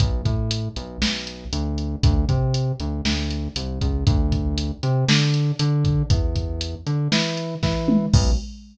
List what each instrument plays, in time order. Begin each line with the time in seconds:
0.00 synth bass 1 B1, kick, closed hi-hat
0.25 synth bass 1 A2, kick, closed hi-hat
0.51 closed hi-hat
0.76 synth bass 1 B1, closed hi-hat
1.02 synth bass 1 B1, snare
1.27 closed hi-hat
1.53 synth bass 1 D2, closed hi-hat
1.78 closed hi-hat
2.03 synth bass 1 D2, kick, closed hi-hat
2.29 synth bass 1 C3, kick, closed hi-hat
2.54 closed hi-hat
2.80 synth bass 1 D2, closed hi-hat
3.05 synth bass 1 D2, snare
3.31 closed hi-hat
3.56 synth bass 1 C2, closed hi-hat
3.81 synth bass 1 C#2, kick, closed hi-hat
4.07 synth bass 1 D2, kick, closed hi-hat
4.32 kick, closed hi-hat
4.58 closed hi-hat
4.83 synth bass 1 C3, closed hi-hat
5.08 synth bass 1 D3, snare
5.34 closed hi-hat
5.59 synth bass 1 D3, closed hi-hat
5.85 kick, closed hi-hat
6.10 synth bass 1 E2, kick, closed hi-hat
6.35 kick, closed hi-hat
6.61 closed hi-hat
6.86 synth bass 1 D3, closed hi-hat
7.12 synth bass 1 E3, snare
7.37 closed hi-hat
7.63 synth bass 1 E3, kick, snare
7.88 mid tom
8.13 synth bass 1 B1, kick, crash